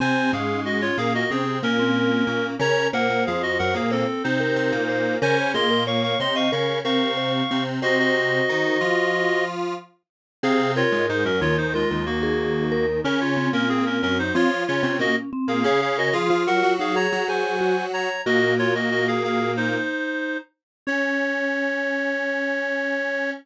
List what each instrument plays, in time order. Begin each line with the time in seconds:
0.00 lead 1 (square) C3 C4, vibraphone C4, clarinet C5 G#5
0.33 lead 1 (square) G#2 G#3, vibraphone C#4, clarinet G#4 F5
0.65 clarinet F#4 D#5
0.82 clarinet F4 C#5
0.97 lead 1 (square) A#2 A#3, clarinet G#4 F5
1.15 clarinet F#4 D#5
1.30 lead 1 (square) C3 C4, clarinet C4 G#4, vibraphone C#4
1.63 lead 1 (square) A#2 A#3, clarinet C#4 A#4
1.79 vibraphone C4
2.27 lead 1 (square) A#2 A#3, vibraphone C#4
2.59 lead 1 (square) C#3 C#4, vibraphone A#4, clarinet C#5 A#5
2.93 lead 1 (square) A#2 A#3, clarinet A#4 F#5, vibraphone C5
3.10 lead 1 (square) A#2 A#3
3.26 lead 1 (square) F2 F3, clarinet G#4 F5
3.43 clarinet F#4 D#5
3.59 lead 1 (square) F#2 F#3, clarinet A#4 F#5
3.74 lead 1 (square) A#2 A#3, clarinet G#4 F5
3.91 clarinet C4 A4, vibraphone C5
4.24 lead 1 (square) C3 C4, clarinet D#4 C5
4.40 vibraphone A#4
4.56 lead 1 (square) C3 C4
4.72 lead 1 (square) A#2 A#3
4.89 vibraphone C5
5.22 lead 1 (square) C#3 C#4, vibraphone A#4, clarinet C5 G#5
5.54 lead 1 (square) A#2 A#3, vibraphone G#4, clarinet D#5 C6
5.71 vibraphone A#4
5.87 vibraphone C#5, clarinet F5 C#6
6.03 clarinet F5 C#6
6.20 lead 1 (square) C3 C4, clarinet D#5 C6
6.36 vibraphone D#5, clarinet F5 C#6
6.52 lead 1 (square) C#3 C#4, vibraphone A#4, clarinet F5 C#6
6.85 lead 1 (square) C3 C4, vibraphone A#4, clarinet F5 C#6
7.17 vibraphone C5
7.51 lead 1 (square) C3 C4
7.82 lead 1 (square) C3 C4, clarinet F#4 D#5, vibraphone C5
7.99 clarinet F#4 D#5
8.49 lead 1 (square) D#3 D#4
8.81 lead 1 (square) F3 F4
10.43 lead 1 (square) C3 C4, vibraphone G#4, clarinet G#4 F5
10.76 clarinet F4 C#5, vibraphone A#4
10.92 lead 1 (square) G#2 G#3
11.09 lead 1 (square) G#2 G#3, clarinet D#4 C5
11.25 lead 1 (square) F#2 F#3, clarinet C#4 A#4
11.41 lead 1 (square) D#2 D#3, clarinet F4 C#5
11.57 clarinet D#4 C5
11.74 clarinet G#3 F4, vibraphone A#4
11.91 lead 1 (square) D#2 D#3
12.06 clarinet A#3 F#4
12.23 vibraphone G#4
12.72 vibraphone A#4
13.04 lead 1 (square) C#3 C#4, clarinet C#4 A#4, vibraphone C#4
13.21 clarinet F4 C#5
13.37 vibraphone C4
13.53 lead 1 (square) A#2 A#3, clarinet C#4 A#4
13.69 clarinet C4 G#4
13.86 clarinet C#4 A#4
14.02 lead 1 (square) F#2 F#3, clarinet C#4 A#4
14.19 clarinet D#4 C5
14.35 lead 1 (square) F3 F4, vibraphone C4, clarinet F4 C#5
14.67 lead 1 (square) C#3 C#4, clarinet F4 C#5
14.83 lead 1 (square) C3 C4, vibraphone C#4
14.99 lead 1 (square) A#2 A#3, clarinet F#4 D#5
15.33 vibraphone C4
15.48 lead 1 (square) A#2 A#3, clarinet G#4 F5
15.64 lead 1 (square) C#3 C#4, clarinet G#4 F5, vibraphone G#4
15.82 clarinet G#4 F5
15.98 clarinet F#4 D#5, vibraphone A#4
16.13 lead 1 (square) F3 F4, vibraphone G#4, clarinet G#4 F5
16.30 lead 1 (square) F3 F4, vibraphone F4
16.47 lead 1 (square) F#3 F#4, clarinet A#4 F#5
16.63 lead 1 (square) F#3 F#4
16.79 vibraphone D#4, clarinet G#4 F5
16.96 vibraphone G#4, clarinet C#5 A#5
17.12 lead 1 (square) F#3 F#4
17.28 vibraphone G#4, clarinet C5 G#5
17.61 vibraphone F#4
17.93 clarinet C#5 A#5
18.26 lead 1 (square) A#2 A#3, clarinet F#4 D#5, vibraphone F#4
18.59 clarinet F4 C#5
18.75 clarinet F#4 D#5
18.91 clarinet F#4 D#5
19.08 clarinet G#4 F5
19.24 clarinet G#4 F5
19.57 clarinet D#4 C5
20.87 vibraphone C#4, lead 1 (square) C#4, clarinet C#5